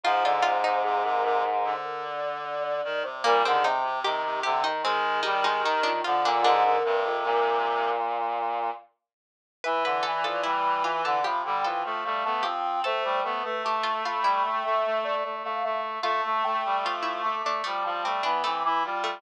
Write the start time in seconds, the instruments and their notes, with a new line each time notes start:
0.04 brass section G#2, clarinet F3, harpsichord F4, ocarina C5
0.25 clarinet D3, harpsichord F4, ocarina D5
0.42 clarinet C3, harpsichord F4, ocarina C5
0.64 clarinet C3, harpsichord D#4
0.84 clarinet C3, ocarina G#4
1.04 clarinet C3, ocarina A#4
1.24 clarinet C3, ocarina A#4
1.64 clarinet D3, ocarina C5
1.85 ocarina A#4
2.03 ocarina D5
2.45 ocarina D5
2.64 ocarina D5
2.84 clarinet D#3
3.04 clarinet C3, ocarina C5
3.24 brass section A#2, clarinet G3, harpsichord A#3, ocarina A#4
3.44 brass section D3, clarinet D#3, harpsichord C4, ocarina G#4
3.63 brass section C3, clarinet C3, harpsichord D#4, ocarina C5
3.84 clarinet C3
4.04 clarinet C3, brass section D#3, harpsichord G4, ocarina G4
4.24 clarinet C3
4.43 brass section C3, clarinet D3, harpsichord G4
4.63 brass section D#3, harpsichord D#4
4.83 clarinet D#3, brass section G#3, harpsichord C4, ocarina G#4
5.23 brass section G3, harpsichord D#4, ocarina G4
5.43 brass section G#3, harpsichord D#4, ocarina G4
5.63 brass section D#3, harpsichord D#4, ocarina G4
5.83 harpsichord D4, ocarina F4
6.04 brass section D3, clarinet F3, harpsichord F4
6.24 brass section A#2, clarinet D3, harpsichord D4, ocarina F4
6.42 brass section G#2, clarinet D3, harpsichord D4, ocarina A#4
6.64 clarinet D3
6.84 brass section G2, clarinet C3
7.05 brass section F2
7.25 brass section A#2
9.64 brass section E3, clarinet E3, harpsichord B4, ocarina E5
9.85 brass section D3, harpsichord B4
10.03 brass section E3, harpsichord A4, ocarina D5
10.23 brass section F3, harpsichord A4
10.43 brass section G3, harpsichord E4, ocarina B5
10.84 brass section E3, harpsichord F4, ocarina D6
11.04 brass section D3, harpsichord A4, ocarina D6
11.23 clarinet C3, brass section F3, harpsichord G4, ocarina B5
11.44 clarinet D3, brass section G3, ocarina G5
11.64 clarinet E3, brass section F3, harpsichord A4
11.83 clarinet F3, brass section A3, ocarina F5
12.04 clarinet G3, brass section A3, ocarina F5
12.24 brass section A3, clarinet B3, ocarina A5
12.42 brass section F3, clarinet C4, harpsichord G4, ocarina G5
12.84 brass section A3, clarinet A3, harpsichord A4, ocarina C5
13.04 brass section G3
13.23 brass section A3, clarinet B3, ocarina B4
13.43 brass section A3, clarinet A3
13.64 brass section A3, harpsichord G4, ocarina A5
13.83 harpsichord F4
14.04 brass section A3, harpsichord F4, ocarina B5
14.22 brass section G3, harpsichord E4, ocarina B5
14.44 brass section A3, ocarina G5
14.64 brass section A3, ocarina E5
14.85 brass section A3
15.04 brass section A3, ocarina D5
15.24 brass section A3, ocarina D5
15.44 brass section A3, ocarina F5
15.64 brass section A3, ocarina E5
16.02 brass section A3, clarinet A3, harpsichord F4, ocarina A5
16.25 brass section A3
16.43 brass section A3, ocarina G5
16.65 brass section G3
16.84 brass section F3, harpsichord F4, ocarina D6
17.03 harpsichord E4
17.23 brass section A3, ocarina D6
17.43 brass section A3, harpsichord D4, ocarina D6
17.64 clarinet F3, brass section G3, harpsichord A3, ocarina D6
17.83 brass section F3, clarinet G3, ocarina A5
18.02 brass section G3, clarinet A3, harpsichord C4
18.23 brass section E3, clarinet B3, harpsichord D4, ocarina B5
18.44 brass section E3, harpsichord A3, clarinet C4, ocarina D6
18.64 brass section E3, clarinet E4, ocarina D6
18.84 brass section G3, clarinet F4, ocarina C6
19.04 harpsichord A3